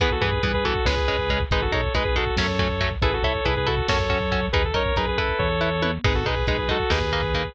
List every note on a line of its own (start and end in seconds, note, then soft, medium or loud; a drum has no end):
0.00 0.20 E2 medium
0.00 0.09 E3 medium
0.00 0.09 B3 medium
0.00 0.11 G#4 medium
0.00 0.11 B4 medium
0.00 kick loud
0.00 closed hi-hat loud
0.11 0.22 F#4 medium
0.11 0.22 A4 medium
0.11 kick medium
0.21 0.40 G2 medium
0.21 0.30 E3 medium
0.21 0.30 B3 medium
0.21 0.42 G#4 medium
0.21 0.42 B4 medium
0.21 kick medium
0.21 closed hi-hat medium
0.32 kick medium
0.43 0.80 G2 medium
0.43 0.52 E3 medium
0.43 0.52 B3 medium
0.43 0.53 G#4 medium
0.43 0.53 B4 medium
0.43 kick loud
0.43 closed hi-hat loud
0.54 0.64 G#4 medium
0.54 0.64 B4 medium
0.54 kick loud
0.64 0.73 E3 medium
0.64 0.73 B3 medium
0.64 0.85 F#4 medium
0.64 0.85 A4 medium
0.64 kick medium
0.64 closed hi-hat medium
0.75 kick medium
0.85 1.45 C#2 medium
0.85 0.95 G#3 medium
0.85 0.95 C#4 medium
0.85 1.41 G#4 medium
0.85 1.41 B4 loud
0.85 kick medium
0.85 snare loud
0.97 kick medium
1.08 1.17 G#3 medium
1.08 1.17 C#4 medium
1.08 kick medium
1.08 closed hi-hat medium
1.18 kick medium
1.29 1.38 G#3 medium
1.29 1.38 C#4 medium
1.29 kick medium
1.29 closed hi-hat medium
1.40 kick medium
1.51 1.69 G#1 medium
1.51 1.61 G#3 medium
1.51 1.61 D#4 medium
1.51 1.62 G#4 medium
1.51 1.62 B4 medium
1.51 kick loud
1.51 closed hi-hat loud
1.61 1.72 F#4 medium
1.61 1.72 A4 medium
1.61 kick medium
1.71 1.90 B1 medium
1.71 1.81 G#3 medium
1.71 1.81 D#4 medium
1.71 1.93 A4 medium
1.71 1.93 C#5 medium
1.71 kick medium
1.71 closed hi-hat medium
1.83 kick medium
1.94 2.31 B1 medium
1.94 2.03 G#3 medium
1.94 2.03 D#4 medium
1.94 2.04 G#4 medium
1.94 2.04 B4 medium
1.94 kick medium
1.94 closed hi-hat loud
2.05 2.15 G#4 medium
2.05 2.15 B4 medium
2.05 kick medium
2.15 2.24 G#3 medium
2.15 2.24 D#4 medium
2.15 2.35 F#4 medium
2.15 2.35 A4 medium
2.15 kick medium
2.15 closed hi-hat medium
2.27 kick medium
2.37 2.96 F#2 medium
2.37 2.47 F#3 medium
2.37 2.47 A3 medium
2.37 2.47 C#4 medium
2.37 2.90 A4 medium
2.37 2.90 C#5 medium
2.37 kick medium
2.37 snare loud
2.48 kick medium
2.59 2.68 F#3 medium
2.59 2.68 A3 medium
2.59 2.68 C#4 medium
2.59 kick loud
2.59 closed hi-hat medium
2.70 kick medium
2.80 2.89 F#3 medium
2.80 2.89 A3 medium
2.80 2.89 C#4 medium
2.80 kick medium
2.80 closed hi-hat medium
2.91 kick medium
3.02 3.20 A1 medium
3.02 3.11 E4 medium
3.02 3.13 G#4 medium
3.02 3.11 A4 medium
3.02 3.13 B4 loud
3.02 kick loud
3.02 closed hi-hat loud
3.12 3.23 F#4 medium
3.12 3.23 A4 medium
3.12 kick medium
3.22 3.41 C2 medium
3.22 3.33 E4 medium
3.22 3.44 A4 medium
3.22 3.33 A4 medium
3.22 3.44 C#5 medium
3.22 kick medium
3.22 closed hi-hat medium
3.35 kick medium
3.45 3.82 C2 medium
3.45 3.54 E4 medium
3.45 3.55 G#4 medium
3.45 3.54 A4 medium
3.45 3.55 B4 medium
3.45 kick medium
3.45 closed hi-hat loud
3.56 3.67 G#4 medium
3.56 3.67 B4 medium
3.56 kick medium
3.66 3.75 E4 medium
3.66 3.87 F#4 medium
3.66 3.75 A4 medium
3.66 3.87 A4 medium
3.66 kick medium
3.66 closed hi-hat medium
3.77 kick medium
3.88 4.49 F#2 medium
3.88 3.98 C#4 medium
3.88 3.98 F#4 loud
3.88 4.46 A4 medium
3.88 3.98 A4 medium
3.88 4.46 C#5 medium
3.88 kick medium
3.88 snare loud
3.99 kick medium
4.10 4.18 C#4 medium
4.10 4.18 F#4 medium
4.10 4.18 A4 medium
4.10 kick medium
4.10 closed hi-hat medium
4.21 kick medium
4.32 4.40 C#4 medium
4.32 4.40 F#4 medium
4.32 4.40 A4 medium
4.32 kick medium
4.32 closed hi-hat medium
4.42 kick medium
4.52 4.72 D#2 medium
4.52 4.62 D#4 medium
4.52 4.63 G#4 medium
4.52 4.62 A#4 medium
4.52 4.63 B4 loud
4.52 kick loud
4.52 closed hi-hat loud
4.64 4.75 A4 medium
4.64 kick medium
4.74 4.93 F#2 medium
4.74 4.83 D#4 medium
4.74 4.83 A#4 medium
4.74 4.95 A#4 medium
4.74 4.95 C#5 loud
4.74 kick medium
4.74 closed hi-hat medium
4.86 kick medium
4.96 5.35 F#2 medium
4.96 5.05 D#4 medium
4.96 5.07 G#4 medium
4.96 5.05 A#4 medium
4.96 5.07 B4 medium
4.96 kick medium
4.96 closed hi-hat loud
5.07 5.18 G#4 medium
5.07 5.18 B4 medium
5.07 kick medium
5.18 5.48 E4 medium
5.18 5.38 A4 medium
5.18 5.48 B4 medium
5.18 kick medium
5.18 closed hi-hat medium
5.29 kick medium
5.39 5.99 E2 medium
5.39 5.91 A4 medium
5.39 5.91 C#5 medium
5.39 kick medium
5.39 floor tom medium
5.61 5.69 E4 medium
5.61 5.69 B4 medium
5.82 5.91 E4 medium
5.82 5.91 B4 medium
5.82 high tom loud
6.04 6.24 G#1 medium
6.04 6.13 G#3 medium
6.04 6.13 D#4 medium
6.04 6.15 G#4 medium
6.04 6.15 B4 medium
6.04 kick loud
6.04 crash loud
6.14 6.25 F#4 medium
6.14 6.25 A4 medium
6.14 kick medium
6.25 6.44 B1 medium
6.25 6.35 G#3 medium
6.25 6.35 D#4 medium
6.25 6.46 G#4 medium
6.25 6.46 B4 medium
6.25 kick medium
6.25 closed hi-hat medium
6.36 kick medium
6.47 6.84 B1 medium
6.47 6.56 G#3 medium
6.47 6.56 D#4 medium
6.47 6.57 G#4 medium
6.47 6.57 B4 medium
6.47 kick loud
6.47 closed hi-hat loud
6.58 6.68 G#4 medium
6.58 6.68 B4 medium
6.58 kick medium
6.69 6.77 G#3 medium
6.69 6.77 D#4 medium
6.69 6.90 F#4 medium
6.69 6.90 A4 medium
6.69 kick medium
6.69 closed hi-hat medium
6.80 kick medium
6.90 7.50 D#2 medium
6.90 6.99 A#3 medium
6.90 6.99 D#4 medium
6.90 7.53 G#4 medium
6.90 7.53 B4 medium
6.90 kick medium
6.90 snare loud
7.01 kick medium
7.12 7.21 A#3 medium
7.12 7.21 D#4 medium
7.12 kick medium
7.12 closed hi-hat medium
7.23 kick medium
7.34 7.43 A#3 medium
7.34 7.43 D#4 medium
7.34 kick medium
7.34 closed hi-hat medium
7.45 kick medium